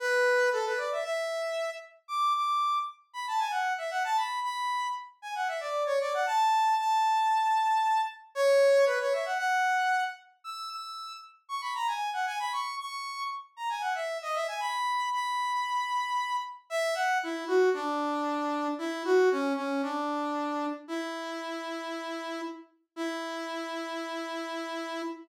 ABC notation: X:1
M:4/4
L:1/16
Q:1/4=115
K:Emix
V:1 name="Brass Section"
B4 A B d e e6 z2 | d'2 d'4 z2 b a g f2 e f a | b2 b4 z2 g f e d2 c d f | a4 a10 z2 |
[K:F#mix] c4 B c e f f6 z2 | e'2 e'4 z2 c' b a g2 f g b | c'2 c'4 z2 a g f e2 d e g | b4 b10 z2 |
[K:Emix] e2 f2 E2 F2 D8 | E2 F2 C2 C2 D8 | E14 z2 | E16 |]